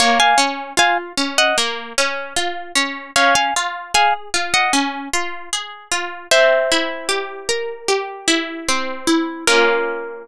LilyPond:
<<
  \new Staff \with { instrumentName = "Pizzicato Strings" } { \time 4/4 \key bes \minor \tempo 4 = 76 <des'' f''>16 <f'' aes''>16 r8 <f'' aes''>16 r8 <ees'' ges''>16 r2 | <des'' f''>16 <f'' aes''>16 r8 <f'' aes''>16 r8 <ees'' ges''>16 r2 | <c'' e''>2~ <c'' e''>8 r4. | bes'1 | }
  \new Staff \with { instrumentName = "Harpsichord" } { \time 4/4 \key bes \minor bes8 des'8 f'8 des'8 bes8 des'8 f'8 des'8 | des'8 f'8 aes'8 f'8 des'8 f'8 aes'8 f'8 | c'8 e'8 g'8 bes'8 g'8 e'8 c'8 e'8 | <bes des' f'>1 | }
>>